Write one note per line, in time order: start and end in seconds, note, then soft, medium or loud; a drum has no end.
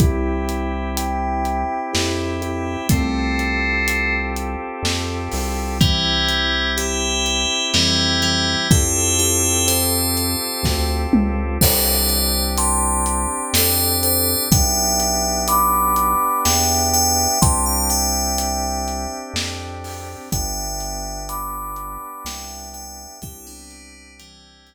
0.00 1.65 C2 loud
0.00 2.88 C4 medium
0.00 0.89 E4 medium
0.00 2.88 E4 loud
0.00 0.89 G4 loud
0.00 2.88 G4 medium
0.00 kick medium
0.00 closed hi-hat medium
0.49 closed hi-hat medium
0.97 1.80 E5 medium
0.97 1.80 G5 medium
0.97 closed hi-hat medium
1.45 closed hi-hat medium
1.94 2.77 F2 medium
1.94 2.33 E4 medium
1.94 2.33 G4 loud
1.94 snare medium
2.42 2.83 E4 medium
2.42 2.83 G4 loud
2.42 closed hi-hat medium
2.89 4.56 C2 loud
2.89 4.13 A3 loud
2.89 4.13 C4 loud
2.89 5.78 C4 medium
2.89 5.78 F4 medium
2.89 5.78 G4 loud
2.89 5.78 A4 medium
2.89 kick medium
2.89 closed hi-hat loud
3.39 closed hi-hat medium
3.88 closed hi-hat medium
4.36 closed hi-hat medium
4.83 5.29 F2 medium
4.83 snare medium
5.32 7.46 C2 medium
5.32 open hi-hat medium
5.81 6.70 E3 medium
5.81 6.70 G3 loud
5.81 8.68 C4 medium
5.81 8.68 E4 loud
5.81 8.68 G4 medium
5.81 kick medium
5.81 closed hi-hat medium
6.29 closed hi-hat medium
6.77 7.65 E4 medium
6.77 7.65 G4 medium
6.77 closed hi-hat medium
7.26 closed hi-hat medium
7.74 8.56 F2 medium
7.74 8.21 E3 medium
7.74 8.21 G3 loud
7.74 snare medium
8.22 8.66 E3 medium
8.22 8.66 G3 medium
8.22 closed hi-hat medium
8.71 10.36 F2 loud
8.71 11.58 C4 medium
8.71 9.17 E4 loud
8.71 11.58 F4 medium
8.71 11.58 G4 medium
8.71 9.17 G4 loud
8.71 11.58 A4 medium
8.71 kick loud
8.71 closed hi-hat medium
9.19 9.66 E4 medium
9.19 9.66 G4 loud
9.19 closed hi-hat medium
9.68 10.91 A4 medium
9.68 10.91 C5 medium
9.68 closed hi-hat medium
10.17 closed hi-hat medium
10.63 11.07 D2 medium
10.63 kick medium
10.63 snare medium
11.13 11.58 C#2 medium
11.13 mid tom loud
11.61 13.27 C2 loud
11.61 14.49 C4 loud
11.61 14.49 D4 medium
11.61 14.49 G4 loud
11.61 12.43 A4 loud
11.61 12.43 C5 loud
11.61 kick medium
11.61 crash loud
12.09 closed hi-hat medium
12.58 13.45 A5 medium
12.58 13.45 C6 loud
12.58 closed hi-hat medium
13.06 closed hi-hat medium
13.53 14.36 F2 loud
13.53 13.97 A4 medium
13.53 13.97 C5 loud
13.53 snare loud
14.03 14.43 A4 medium
14.03 14.43 C5 loud
14.03 closed hi-hat medium
14.51 16.16 B1 medium
14.51 17.39 B3 loud
14.51 17.39 D4 medium
14.51 17.39 G4 medium
14.51 15.43 E5 loud
14.51 15.43 G5 loud
14.51 kick loud
14.51 closed hi-hat loud
15.00 closed hi-hat medium
15.48 16.40 B5 medium
15.48 16.40 D6 medium
15.48 closed hi-hat medium
15.96 closed hi-hat medium
16.45 17.28 E2 medium
16.45 16.88 E5 medium
16.45 16.88 G5 loud
16.45 snare medium
16.94 17.39 E5 medium
16.94 17.39 G5 loud
16.94 closed hi-hat medium
17.42 19.07 C2 loud
17.42 20.30 C4 loud
17.42 20.30 D4 medium
17.42 20.30 G4 loud
17.42 17.65 A5 loud
17.42 17.65 C6 loud
17.42 kick medium
17.42 closed hi-hat loud
17.66 17.89 F5 medium
17.66 17.89 A5 loud
17.90 19.16 E5 medium
17.90 19.16 G5 medium
17.90 closed hi-hat medium
18.38 closed hi-hat medium
18.88 closed hi-hat medium
19.33 20.16 F2 medium
19.33 snare loud
19.84 open hi-hat medium
20.32 21.98 G1 loud
20.32 23.20 B3 medium
20.32 23.20 D4 loud
20.32 23.20 G4 medium
20.32 21.23 E5 loud
20.32 21.23 G5 loud
20.32 kick medium
20.32 closed hi-hat medium
20.80 closed hi-hat medium
21.29 22.23 B5 medium
21.29 22.23 D6 medium
21.29 closed hi-hat medium
21.76 closed hi-hat medium
22.25 23.07 C2 loud
22.25 22.69 E5 medium
22.25 22.69 G5 loud
22.25 snare loud
22.74 23.16 E5 medium
22.74 23.16 G5 medium
22.74 closed hi-hat medium
23.22 24.74 C2 loud
23.22 24.74 C4 loud
23.22 24.74 D4 loud
23.22 23.46 E4 loud
23.22 24.74 G4 loud
23.22 23.46 G4 loud
23.22 kick loud
23.22 closed hi-hat medium
23.47 24.13 B3 medium
23.47 24.13 D4 loud
23.71 closed hi-hat medium
24.19 24.74 E3 medium
24.19 24.74 G3 loud
24.19 closed hi-hat loud
24.67 closed hi-hat medium